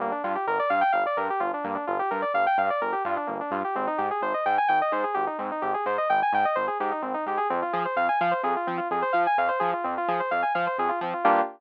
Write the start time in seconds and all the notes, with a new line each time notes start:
0.00 G1 A#3
0.12 D4
0.24 G2 F4
0.35 G4
0.47 G1 A#4
0.59 D5
0.70 G2 F5
0.81 G5
0.92 G1 F5
1.06 D5
1.17 G2 A#4
1.30 G4
1.40 G1 F4
1.54 D4
1.64 G2 A#3
1.75 D4
1.87 G1 F4
1.99 G4
2.11 G2 A#4
2.22 D5
2.34 G1 F5
2.46 G5
2.58 G2 F5
2.70 D5
2.81 G1 A#4
2.92 G4
3.05 G2 F4
3.17 D4
3.27 G1 A#3
3.41 D4
3.51 G2 F4
3.64 G4
3.75 G#1 C4
3.87 D#4
3.98 G#2 G4
4.11 G#4
4.21 G#1 C5
4.34 D#5
4.46 G#2 G5
4.58 G#5
4.68 G#1 G5
4.82 D#5
4.92 G#2 C5
5.04 G#4
5.14 G#1 G4
5.27 D#4
5.38 G#2 C4
5.51 D#4
5.62 G#1 G4
5.74 G#4
5.86 G#2 C5
5.98 D#5
6.09 G#1 G5
6.22 G#5
6.33 G#2 G5
6.45 D#5
6.55 G#1 C5
6.67 G#4
6.80 G#2 G4
6.91 D#4
7.02 G#1 C4
7.14 D#4
7.26 G#2 G4
7.37 G#4
7.50 F2 C4
7.62 F4
7.73 F3 G#4
7.85 C5
7.96 F2 F5
8.09 G#5
8.21 F3 F5
8.31 C5
8.43 F2 G#4
8.56 F4
8.67 F3 C4
8.77 F4
8.91 F2 G#4
9.02 C5
9.13 F3 F5
9.27 G#5
9.38 F2 F5
9.48 C5
9.59 F3 G#4
9.73 F4
9.84 F2 C4
9.98 F4
10.08 F3 G#4
10.20 C5
10.31 F2 F5
10.42 G#5
10.55 F3 F5
10.67 C5
10.78 F2 G#4
10.89 F4
11.01 F3 C4
11.13 F4
11.24 G2 A#3 D4 F4 G4